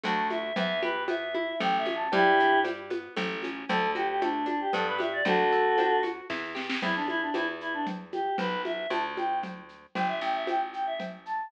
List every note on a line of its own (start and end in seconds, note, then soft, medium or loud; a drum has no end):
0.03 0.53 D2 loud
0.03 0.50 A3 loud
0.03 0.50 D4 loud
0.03 0.50 F#4 loud
0.03 0.27 A5 medium
0.03 cowbell medium
0.03 low conga medium
0.03 shaker medium
0.30 0.55 E5 medium
0.30 high conga medium
0.30 shaker medium
0.56 1.53 E2 loud
0.56 0.83 B3 loud
0.56 0.80 E5 loud
0.56 cowbell loud
0.56 low conga loud
0.56 shaker medium
0.82 1.09 G4 medium
0.82 1.04 B4 medium
0.82 high conga medium
0.82 shaker medium
1.08 1.35 B3 medium
1.08 1.56 E5 medium
1.08 cowbell medium
1.08 high conga medium
1.08 shaker medium
1.35 1.60 E4 loud
1.35 high conga medium
1.60 2.08 A1 loud
1.60 1.86 A3 loud
1.60 1.77 G5 loud
1.60 cowbell medium
1.60 low conga medium
1.60 shaker medium
1.78 1.95 E5 medium
1.86 2.10 C#4 medium
1.86 high conga medium
1.86 shaker medium
1.95 2.12 A5 medium
2.12 3.09 G2 loud
2.12 2.39 G3 loud
2.12 2.59 E4 loud
2.12 2.59 G4 loud
2.12 cowbell loud
2.12 low conga loud
2.12 shaker medium
2.39 2.67 D4 loud
2.39 shaker medium
2.64 2.91 G3 medium
2.64 cowbell medium
2.64 high conga medium
2.64 shaker medium
2.90 3.15 B3 medium
2.90 high conga medium
2.90 shaker medium
3.17 3.65 A1 loud
3.17 3.43 A3 loud
3.17 cowbell medium
3.17 low conga loud
3.17 shaker medium
3.43 3.69 C#4 medium
3.43 high conga medium
3.43 shaker medium
3.69 4.66 D2 loud
3.69 3.96 A3 loud
3.69 3.90 A4 loud
3.69 cowbell loud
3.69 low conga loud
3.69 shaker medium
3.95 4.22 F#4 loud
3.95 4.08 G4 medium
3.95 high conga medium
3.95 shaker medium
4.08 4.21 G4 medium
4.21 4.48 A3 loud
4.21 4.46 D4 medium
4.21 cowbell medium
4.21 high conga medium
4.21 shaker medium
4.46 4.71 D4 medium
4.46 4.60 D4 medium
4.46 high conga medium
4.46 shaker medium
4.61 4.73 G4 medium
4.73 5.22 G2 loud
4.73 4.99 B3 loud
4.73 4.86 A4 medium
4.73 cowbell medium
4.73 low conga medium
4.73 shaker medium
4.87 4.99 B4 loud
4.98 5.23 G4 medium
4.98 5.12 E5 medium
4.98 high conga medium
4.98 shaker medium
5.13 5.25 D5 medium
5.25 6.21 D2 loud
5.25 5.53 D4 loud
5.25 6.01 F#4 loud
5.25 6.01 A4 loud
5.25 cowbell loud
5.25 low conga loud
5.25 shaker medium
5.52 5.78 A4 medium
5.52 shaker medium
5.78 6.04 D4 medium
5.78 cowbell loud
5.78 high conga medium
5.78 shaker medium
6.03 6.28 F#4 medium
6.03 high conga medium
6.03 shaker medium
6.30 6.78 E2 medium
6.30 6.56 E4 loud
6.30 kick medium
6.30 snare medium
6.55 6.80 G4 medium
6.55 snare medium
6.70 snare loud
6.82 7.31 E2 medium
6.82 6.95 E4 loud
6.82 cowbell medium
6.82 low conga loud
6.82 shaker medium
6.95 7.08 D4 medium
7.08 7.21 E4 loud
7.08 high conga medium
7.08 shaker medium
7.21 7.34 D4 medium
7.34 8.30 E2 medium
7.34 7.47 E4 medium
7.34 cowbell medium
7.34 high conga medium
7.34 shaker medium
7.61 7.73 E4 medium
7.61 shaker medium
7.73 7.86 D4 medium
7.86 cowbell medium
7.86 low conga medium
7.86 shaker medium
8.12 8.36 G4 medium
8.12 high conga medium
8.12 shaker medium
8.38 8.87 B1 medium
8.38 8.62 B4 loud
8.38 cowbell medium
8.38 low conga loud
8.38 shaker medium
8.65 8.88 E5 medium
8.65 high conga medium
8.65 shaker medium
8.90 9.86 D2 medium
8.90 9.03 A5 medium
8.90 cowbell medium
8.90 high conga medium
8.90 shaker medium
9.17 9.39 G5 medium
9.17 high conga medium
9.17 shaker medium
9.43 cowbell medium
9.43 low conga medium
9.43 shaker medium
9.69 shaker medium
9.95 10.21 G1 medium
9.95 10.08 G5 medium
9.95 cowbell medium
9.95 low conga loud
9.95 shaker medium
10.08 10.21 E5 medium
10.21 11.43 A1 medium
10.21 10.34 G5 medium
10.21 shaker medium
10.35 10.47 E5 medium
10.47 10.60 G5 medium
10.47 cowbell medium
10.47 high conga medium
10.47 shaker medium
10.73 10.86 G5 medium
10.73 shaker medium
10.87 10.99 E5 medium
11.00 cowbell medium
11.00 low conga medium
11.00 shaker medium
11.26 11.48 A5 medium
11.26 shaker medium